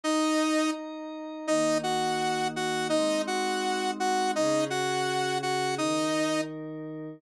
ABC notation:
X:1
M:4/4
L:1/8
Q:1/4=167
K:Ebdor
V:1 name="Lead 2 (sawtooth)"
[Ee]4 z4 | [Ee]2 [Gg]4 [Gg]2 | [Ee]2 [Gg]4 [Gg]2 | [Ee]2 [Gg]4 [Gg]2 |
[Ee]4 z4 |]
V:2 name="Pad 5 (bowed)"
[Eeb]8 | [E,B,E]8 | [A,CE]8 | [D,DA]8 |
[E,EB]8 |]